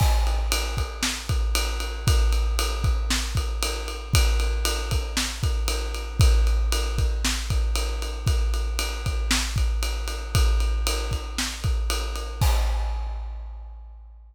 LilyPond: \new DrumStaff \drummode { \time 4/4 \tempo 4 = 116 <cymc bd>8 cymr8 cymr8 <bd cymr>8 sn8 <bd cymr>8 cymr8 cymr8 | <bd cymr>8 cymr8 cymr8 <bd cymr>8 sn8 <bd cymr>8 cymr8 cymr8 | <bd cymr>8 cymr8 cymr8 <bd cymr>8 sn8 <bd cymr>8 cymr8 cymr8 | <bd cymr>8 cymr8 cymr8 <bd cymr>8 sn8 <bd cymr>8 cymr8 cymr8 |
<bd cymr>8 cymr8 cymr8 <bd cymr>8 sn8 <bd cymr>8 cymr8 cymr8 | <bd cymr>8 cymr8 cymr8 <bd cymr>8 sn8 <bd cymr>8 cymr8 cymr8 | <cymc bd>4 r4 r4 r4 | }